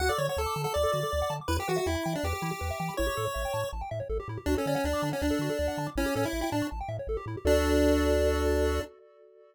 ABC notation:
X:1
M:4/4
L:1/16
Q:1/4=161
K:D
V:1 name="Lead 1 (square)"
f d c c A3 A d8 | B G F F E3 D G8 | c8 z8 | D C C C D3 C D8 |
C2 C E2 E D2 z8 | D16 |]
V:2 name="Lead 1 (square)"
F A d f a d' a f d A F A d f a d' | E G B e g b g e B G E G B e g b | E G A c e g a c' a g e c A G E G | F A d f a d' a f d A F A d f a d' |
E G A c e g a c' a g e c A G E G | [FAd]16 |]
V:3 name="Synth Bass 1" clef=bass
D,,2 D,2 D,,2 D,2 D,,2 D,2 D,,2 D,2 | E,,2 E,2 E,,2 E,2 E,,2 E,2 E,,2 E,2 | A,,,2 A,,2 A,,,2 A,,2 A,,,2 A,,2 A,,,2 A,,2 | D,,2 D,2 D,,2 D,2 D,,2 D,2 D,,2 D,2 |
A,,,2 A,,2 A,,,2 A,,2 A,,,2 A,,2 A,,,2 A,,2 | D,,16 |]